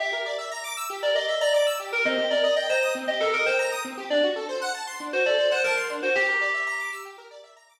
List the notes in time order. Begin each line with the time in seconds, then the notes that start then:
0.00 G4 E5
0.13 A#4
0.26 D5
0.38 E5
0.51 A#5
0.64 D6
0.77 E6
0.90 G4
1.03 A#4 D5
1.15 D5 D#5
1.28 E5
1.41 D5 A#5
1.54 D5 D6
1.67 E6
1.80 G4
1.92 A#4
2.05 C4 D#5
2.18 G4
2.30 A#4 D5
2.44 D#5
2.56 D#5 G5
2.69 C5 A#5
2.82 D#6
2.95 C4
3.08 G4 D#5
3.20 A4 A#4
3.33 A#4 D#5
3.46 C5 G5
3.59 A#5
3.72 D#6
3.85 C4
3.97 G4
4.10 D4 D5
4.23 F#4
4.36 A4
4.49 C5
4.62 F#5
4.74 A5
4.87 C6
5.00 D4
5.13 F#4 C5
5.26 A4 D5
5.38 C5
5.51 C5 F#5
5.64 A#4 A5
5.77 C6
5.90 D4
6.03 F#4 C5
6.15 G4
6.28 A#4
6.41 D5
6.54 E5
6.67 A#5
6.79 D6
6.92 E6
7.05 G4
7.18 A#4
7.31 D5
7.44 E5
7.56 A#5
7.69 D6